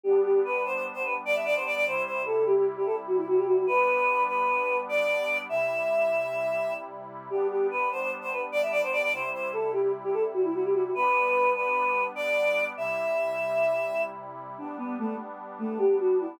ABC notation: X:1
M:9/8
L:1/16
Q:3/8=99
K:G
V:1 name="Choir Aahs"
G2 G2 B2 c c z c B z d e d c d d | c2 c2 A2 G G z G A z F E F G F F | B6 B6 d6 | e14 z4 |
G2 G2 B2 c c z c B z d e d c d d | c2 c2 A2 G G z G A z F E F G F F | B6 B6 d6 | e14 z4 |
D2 B,2 A,2 z4 A,2 G2 F2 E2 |]
V:2 name="Pad 5 (bowed)"
[G,B,D]18 | [C,G,E]18 | [G,B,D]18 | [C,G,E]18 |
[G,B,D]18 | [C,G,E]18 | [G,B,D]18 | [C,G,E]18 |
[G,B,D]18 |]